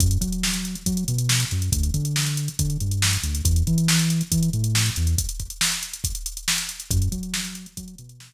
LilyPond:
<<
  \new Staff \with { instrumentName = "Synth Bass 1" } { \clef bass \time 4/4 \key fis \minor \tempo 4 = 139 fis,8 fis4. fis8 b,4 fis,8 | d,8 d4. d8 g,4 d,8 | e,8 e4. e8 a,4 e,8 | r1 |
fis,8 fis4. fis8 b,4 r8 | }
  \new DrumStaff \with { instrumentName = "Drums" } \drummode { \time 4/4 <hh bd>16 hh16 <hh bd>16 hh16 sn16 hh16 hh16 hh16 <hh bd>16 hh16 hh16 hh16 sn16 hh16 hh16 hh16 | <hh bd>16 hh16 <hh bd>16 hh16 sn16 hh16 hh16 hh16 <hh bd>16 hh16 hh16 hh16 sn16 hh16 hh16 hh16 | <hh bd>16 hh16 <hh bd>16 hh16 sn16 hh16 hh16 hh16 <hh bd>16 hh16 hh16 hh16 sn16 hh16 hh16 hh16 | <hh bd>16 hh16 <hh bd>16 hh16 sn16 hh16 hh16 hh16 <hh bd>16 hh16 hh16 hh16 sn16 hh16 hh16 hh16 |
<hh bd>16 hh16 <hh bd>16 hh16 sn16 hh16 hh16 hh16 <hh bd>16 hh16 hh16 hh16 sn16 hh8. | }
>>